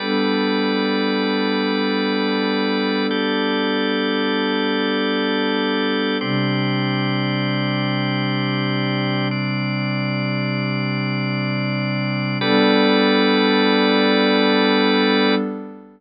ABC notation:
X:1
M:3/4
L:1/8
Q:1/4=58
K:Gmix
V:1 name="Pad 2 (warm)"
[G,B,DA]6- | [G,B,DA]6 | [C,G,D]6- | [C,G,D]6 |
[G,B,DA]6 |]
V:2 name="Drawbar Organ"
[G,ABd]6 | [G,GAd]6 | [CGd]6 | [CDd]6 |
[G,ABd]6 |]